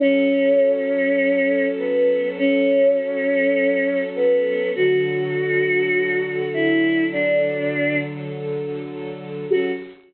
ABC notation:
X:1
M:4/4
L:1/8
Q:1/4=101
K:F#m
V:1 name="Choir Aahs"
C6 B,2 | C6 B,2 | F6 E2 | D3 z5 |
F2 z6 |]
V:2 name="String Ensemble 1"
[F,CA]8- | [F,CA]8 | [D,F,A]8- | [D,F,A]8 |
[F,CA]2 z6 |]